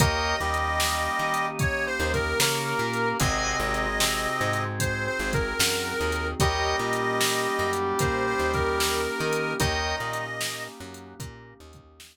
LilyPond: <<
  \new Staff \with { instrumentName = "Harmonica" } { \time 4/4 \key ees \major \tempo 4 = 75 ees''2 \tuplet 3/2 { des''8 c''8 bes'8 } bes'4 | ees''2 \tuplet 3/2 { c''8 c''8 bes'8 } bes'4 | ees''2 \tuplet 3/2 { c''8 c''8 bes'8 } bes'4 | ees''4. r2 r8 | }
  \new Staff \with { instrumentName = "Brass Section" } { \time 4/4 \key ees \major <bes bes'>8 <g g'>4. r4 <bes bes'>4 | <c c'>4 <c c'>4 r2 | <g g'>1 | <ees ees'>4 r2. | }
  \new Staff \with { instrumentName = "Drawbar Organ" } { \time 4/4 \key ees \major <bes' des'' ees'' g''>8 ees4 ees'4 ees8 des'8 bes8 | <c'' ees'' ges'' aes''>8 aes4 aes4 aes8 ges8 ees8 | <bes' des'' ees'' g''>8 bes4 ges8 bes8 ees4 ees'8 | <bes' des'' ees'' g''>8 bes4 ges8 bes8 ees4 r8 | }
  \new Staff \with { instrumentName = "Electric Bass (finger)" } { \clef bass \time 4/4 \key ees \major ees,8 ees,4 ees4 ees,8 des8 bes,8 | aes,,8 aes,,4 aes,4 aes,,8 ges,8 ees,8 | ees,8 bes,4 ges,8 bes,8 ees,4 ees8 | ees,8 bes,4 ges,8 bes,8 ees,4 r8 | }
  \new Staff \with { instrumentName = "Pad 5 (bowed)" } { \time 4/4 \key ees \major <bes des' ees' g'>1 | <c' ees' ges' aes'>1 | <bes des' ees' g'>1 | <bes des' ees' g'>1 | }
  \new DrumStaff \with { instrumentName = "Drums" } \drummode { \time 4/4 \tuplet 3/2 { <hh bd>8 r8 hh8 sn8 r8 hh8 <hh bd>8 r8 <hh bd>8 sn8 r8 hh8 } | \tuplet 3/2 { <hh bd>8 r8 hh8 sn8 r8 hh8 <hh bd>8 r8 <bd hh>8 sn8 r8 hh8 } | \tuplet 3/2 { <hh bd>8 r8 hh8 sn8 r8 hh8 <hh bd>8 r8 <hh bd>8 sn8 r8 hh8 } | \tuplet 3/2 { <hh bd>8 r8 hh8 sn8 r8 hh8 <hh bd>8 r8 <hh bd>8 } sn4 | }
>>